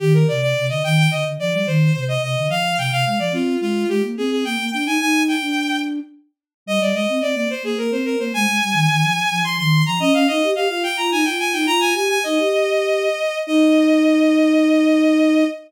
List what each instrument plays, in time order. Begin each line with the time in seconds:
0.00 flute D#3, violin G4
0.14 violin A#4
0.28 flute C3, violin D5
0.42 violin D5
0.57 flute C3
0.69 flute D3, violin D#5
0.84 flute D#3, violin G5
0.98 violin G5
1.11 flute D3, violin D#5
1.25 flute D3
1.40 flute F3, violin D5
1.53 flute G3, violin D5
1.66 flute D#3, violin C5
1.95 flute C3
2.08 violin D#5
2.23 flute C3, violin D#5
2.38 flute D3
2.48 flute F3, violin F5
2.77 flute C3, violin G5
2.92 flute C3, violin F5
3.05 flute G#3, violin F5
3.19 flute F3, violin D5
3.32 flute C4, violin F4
3.61 flute G#3, violin F4
3.89 flute G#3, violin G4
4.03 flute A#3
4.17 flute C4, violin G#4
4.31 violin G#4
4.45 flute A#3, violin G5
4.58 flute A#3
4.72 flute D4, violin G5
4.85 flute D#4, violin G#5
5.00 flute D#4, violin G#5
5.28 violin G5
5.41 flute D4
6.66 flute G3, violin D#5
6.80 flute G3, violin D5
6.93 flute G#3, violin D#5
7.09 flute C4
7.22 flute C4, violin D5
7.34 flute A#3, violin D5
7.50 violin C5
7.63 flute A#3, violin G#4
7.78 flute A#3, violin A#4
7.91 flute C4, violin C5
8.05 violin A#4
8.19 flute A#3, violin C5
8.34 flute G#3, violin G#5
8.47 flute G#3
8.62 flute G3
8.73 flute D#3
8.89 flute D#3
9.03 flute F3
9.31 flute F3
9.44 flute F3, violin C6
9.58 flute D#3, violin C6
9.86 flute F3, violin A#5
9.99 flute C#4, violin D#5
10.13 flute C#4, violin F5
10.27 flute D#4, violin D#5
10.43 flute G4
10.55 flute G4, violin F5
10.69 flute F4, violin F5
10.83 violin G5
10.97 flute F4, violin A#5
11.12 flute D#4, violin G#5
11.25 flute F4, violin G5
11.39 violin G#5
11.53 flute D#4, violin G5
11.66 flute F4, violin A#5
11.80 violin G#5
11.94 flute G4, violin G#5
12.09 violin G#5
12.24 flute D#4, violin D#5
12.38 flute G4
13.47 flute D#4, violin D#5